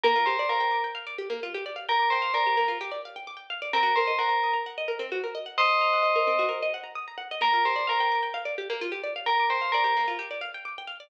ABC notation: X:1
M:4/4
L:1/16
Q:1/4=130
K:Bb
V:1 name="Tubular Bells"
B2 c2 B3 z9 | B2 c2 B3 z9 | B2 c2 B3 z9 | [ce]8 z8 |
B2 c2 B3 z9 | B2 c2 B3 z9 |]
V:2 name="Pizzicato Strings"
B, F G d f g d' g f d G B, F G d f | g d' g f d G B, F G d f g d' g f d | C _G B e _g b e' b g e B C G B e g | b e' b _g e B C _G B e g b e' b g e |
B, F G d f g d' g f d G B, F G d f | g d' g f d G B, F G d f g d' g f d |]